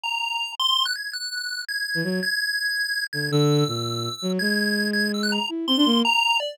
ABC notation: X:1
M:6/8
L:1/16
Q:3/8=110
K:none
V:1 name="Violin"
z12 | z9 E, _G,2 | z10 D,2 | D,4 _B,,5 z _G,2 |
_A,12 | E2 C D _B,2 z6 |]
V:2 name="Lead 1 (square)"
_b6 c'3 _g' _a'2 | _g'6 _a'4 a'2 | _a'10 a'2 | e'12 |
_a'6 a'2 e' _g' _b2 | z2 c'4 _b4 d2 |]